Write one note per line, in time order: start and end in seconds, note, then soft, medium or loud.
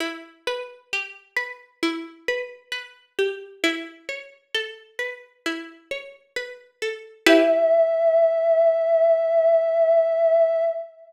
0.00 1.82 E4 medium
0.47 1.36 B4 medium
0.93 3.18 G4 medium
1.37 2.28 B4 medium
1.83 3.55 E4 medium
2.28 2.71 B4 medium
2.72 3.58 B4 medium
3.19 3.62 G4 medium
3.64 5.45 E4 medium
4.09 5.91 C#5 medium
4.54 6.81 A4 medium
4.99 6.36 B4 medium
5.46 7.19 E4 medium
5.91 7.21 C#5 medium
6.36 7.23 B4 medium
6.82 7.25 A4 medium
7.26 10.62 E4 loud
7.26 10.62 G4 loud
7.26 10.62 B4 loud
7.26 10.64 E5 loud